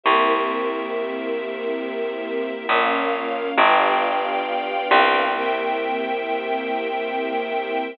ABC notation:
X:1
M:3/4
L:1/8
Q:1/4=68
K:Fm
V:1 name="String Ensemble 1"
[B,C=EG]6 | [B,DF]2 [=B,=DFG]4 | [B,C=EG]6 |]
V:2 name="String Ensemble 1"
[GBc=e]6 | [Bdf]2 [=B=dfg]4 | [Bc=eg]6 |]
V:3 name="Electric Bass (finger)" clef=bass
C,,6 | B,,,2 G,,,3 C,,- | C,,6 |]